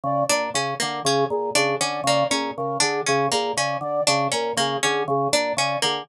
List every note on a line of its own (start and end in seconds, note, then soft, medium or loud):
0.03 0.24 C#3 medium
0.03 0.25 D5 medium
0.29 0.50 A#2 medium
0.29 0.50 D4 medium
0.29 0.50 D5 medium
0.54 0.74 C#3 medium
0.54 0.75 C#4 medium
0.54 0.74 G#4 medium
0.80 1.02 D3 medium
0.80 1.00 A#3 medium
0.80 1.00 A#4 medium
1.04 1.25 C#3 medium
1.04 1.27 C#4 medium
1.04 1.24 G#4 medium
1.30 1.50 A#2 medium
1.30 1.50 G#4 medium
1.55 1.75 C#3 medium
1.55 1.75 D4 medium
1.55 1.76 G#4 medium
1.80 2.01 D3 medium
1.80 2.01 C#4 medium
1.80 2.02 D5 medium
2.04 2.24 C#3 medium
2.04 2.27 A#3 medium
2.04 2.27 D5 medium
2.30 2.51 A#2 medium
2.30 2.51 C#4 medium
2.30 2.52 G#4 medium
2.57 2.78 C#3 medium
2.57 2.77 A#4 medium
2.80 3.02 D3 medium
2.80 3.00 D4 medium
2.80 3.01 G#4 medium
3.06 3.28 C#3 medium
3.06 3.27 C#4 medium
3.06 3.27 G#4 medium
3.32 3.53 A#2 medium
3.32 3.52 A#3 medium
3.32 3.52 G#4 medium
3.57 3.77 C#3 medium
3.57 3.78 C#4 medium
3.57 3.77 D5 medium
3.81 4.01 D3 medium
3.81 4.03 D5 medium
4.07 4.28 C#3 medium
4.07 4.27 D4 medium
4.07 4.28 G#4 medium
4.32 4.53 A#2 medium
4.32 4.52 C#4 medium
4.32 4.53 A#4 medium
4.57 4.77 C#3 medium
4.57 4.78 A#3 medium
4.57 4.79 G#4 medium
4.83 5.04 D3 medium
4.83 5.03 C#4 medium
4.83 5.03 G#4 medium
5.08 5.28 C#3 medium
5.08 5.29 G#4 medium
5.33 5.53 A#2 medium
5.33 5.53 D4 medium
5.33 5.55 D5 medium
5.57 5.77 C#3 medium
5.57 5.78 C#4 medium
5.57 5.79 D5 medium
5.82 6.04 D3 medium
5.82 6.02 A#3 medium
5.82 6.04 G#4 medium